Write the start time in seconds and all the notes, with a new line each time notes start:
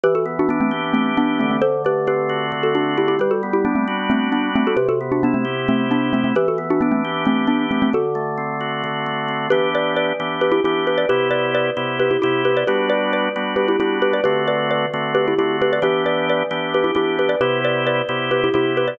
0.04 E3 G4 B4
0.15 F#4 A4
0.26 B3
0.39 D4 F#4
0.49 B3 D4
0.61 A3 C4
0.71 G4
0.93 E3 A3 C4
1.17 B3 D4
1.39 D3 A3 C4
1.51 A3 C4
1.62 A4 C5
1.85 A3 G4 B4
2.07 C4 G4 B4
2.29 F#4
2.52 D3
2.63 F#4 A4
2.75 A3 D4 F#4
2.98 C4 E4 G4
3.08 E4 G4
3.19 G3 G4 B4
3.31 F#4 A4
3.43 B3
3.53 E4 G4
3.65 B3 D4
3.75 A3 C4
3.88 F#4
4.10 G3 A3 C4
4.32 B3 D4
4.56 A3 C4 D4
4.67 F#4 A4
4.77 C3 G4 B4
4.89 F#4 A4
5.01 B3
5.12 D4 F#4
5.23 B3 D4 E4
5.34 A3 C4
5.45 G4
5.68 C3 A3 C4
5.91 B3 D4
6.13 A3 C4 E4
6.24 A3 C4
6.36 E3 G4 B4
6.48 F#4 A4
6.58 B3
6.70 D4 F#4
6.81 B3 D4
6.92 A3 C4
7.05 G4
7.25 E3 A3 C4
7.47 B3 D4
7.71 A3 C4 D4
7.82 A3 C4
7.93 D3 F#4 A4
8.15 A3
8.38 C4
8.61 F#4
8.84 D3
9.06 A3
9.28 C4
9.50 E3 B3 D4 G4 B4
9.75 B4 D5
9.97 B4 D5
10.20 E3 B3 D4 G4
10.41 G4 B4
10.52 E4 G4
10.64 E3 B3 D4 E4 G4
10.87 G4 B4
10.98 B4 D5
11.09 C3 B3 E4 G4 B4
11.31 B4 D5
11.55 B4 D5
11.77 C3 B3 E4 G4
12.00 G4 B4
12.11 E4 G4
12.22 C3 B3 E4 G4
12.45 G4 B4
12.57 B4 D5
12.67 G3 B3 D4 F#4 G4 B4
12.90 B4 D5
13.13 B4 D5
13.36 G3 B3 D4 F#4
13.56 G4 B4
13.68 E4 G4
13.80 G3 B3 D4 E4 F#4 G4
14.02 G4 B4
14.13 B4 D5
14.24 D3 A3 C4 F#4 G4 B4
14.48 B4 D5
14.71 B4 D5
14.94 D3 A3 C4 F#4
15.15 G4 B4
15.28 E4 G4
15.39 D3 A3 C4 E4 F#4 G4
15.62 G4 B4
15.73 B4 D5
15.82 E3 B3 D4 G4 B4
16.06 B4 D5
16.30 B4 D5
16.51 E3 B3 D4 G4
16.74 G4 B4
16.84 E4 G4
16.95 E3 B3 D4 E4 G4
17.19 G4 B4
17.29 B4 D5
17.41 C3 B3 E4 G4 B4
17.65 B4 D5
17.87 B4 D5
18.09 C3 B3 E4 G4
18.31 G4 B4
18.44 E4 G4
18.54 C3 B3 E4 G4
18.77 G4 B4
18.88 B4 D5